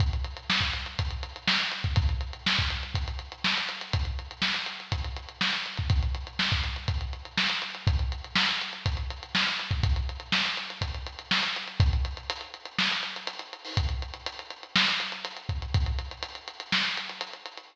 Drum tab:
HH |xxxx-xxxxxxx-xxx|xxxx-xxxxxxx-xxx|xxxx-xxxxxxx-xxx|xxxx-xxxxxxx-xxx|
SD |----o-------o---|----o-------o---|----o-------o---|----o-------o---|
BD |o----o--o------o|o----o--o-------|o-------o------o|o----o--o-------|

HH |xxxx-xxxxxxx-xxx|xxxx-xxxxxxx-xxx|xxxxxxxx-xxxxxxo|xxxxxxxx-xxxxxxx|
SD |----o-------o---|----o-------o---|--------o-------|--------o-------|
BD |o-------o------o|o-------o-------|o---------------|o-------------o-|

HH |xxxxxxxx-xxxxxxx|
SD |--------o-------|
BD |o---------------|